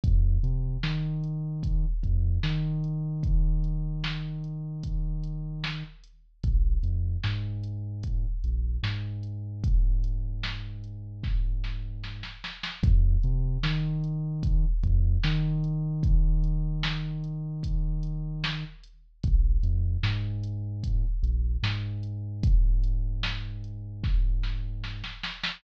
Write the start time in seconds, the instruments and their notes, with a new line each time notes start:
0.04 synth bass 2 F2, kick, closed hi-hat
0.43 synth bass 2 C3, closed hi-hat
0.83 synth bass 2 D#3, snare
1.24 closed hi-hat
1.63 kick, closed hi-hat
2.03 synth bass 2 F2, kick, closed hi-hat
2.43 synth bass 2 D#3, snare
2.84 closed hi-hat
3.23 kick, closed hi-hat
3.64 closed hi-hat
4.04 snare
4.44 closed hi-hat
4.83 kick, closed hi-hat
5.24 closed hi-hat
5.64 snare
6.04 closed hi-hat
6.44 synth bass 2 A#1, kick, closed hi-hat
6.83 synth bass 2 F2, closed hi-hat
7.24 synth bass 2 G#2, snare
7.64 closed hi-hat
8.03 kick, closed hi-hat
8.44 synth bass 2 A#1, closed hi-hat
8.83 synth bass 2 G#2, snare
9.23 closed hi-hat
9.64 kick, closed hi-hat
10.04 closed hi-hat
10.43 snare
10.84 closed hi-hat
11.24 kick, snare
11.64 snare
12.04 snare
12.23 snare
12.44 snare
12.63 snare
12.83 synth bass 2 F2, kick, closed hi-hat
13.23 synth bass 2 C3, closed hi-hat
13.63 synth bass 2 D#3, snare
14.04 closed hi-hat
14.43 kick, closed hi-hat
14.83 synth bass 2 F2, kick, closed hi-hat
15.24 synth bass 2 D#3, snare
15.64 closed hi-hat
16.03 kick, closed hi-hat
16.44 closed hi-hat
16.83 snare
17.24 closed hi-hat
17.63 kick, closed hi-hat
18.03 closed hi-hat
18.44 snare
18.84 closed hi-hat
19.24 synth bass 2 A#1, kick, closed hi-hat
19.63 synth bass 2 F2, closed hi-hat
20.03 synth bass 2 G#2, snare
20.44 closed hi-hat
20.84 kick, closed hi-hat
21.23 synth bass 2 A#1, closed hi-hat
21.63 synth bass 2 G#2, snare
22.03 closed hi-hat
22.43 kick, closed hi-hat
22.84 closed hi-hat
23.23 snare
23.64 closed hi-hat
24.04 kick, snare
24.43 snare
24.84 snare
25.04 snare
25.24 snare
25.44 snare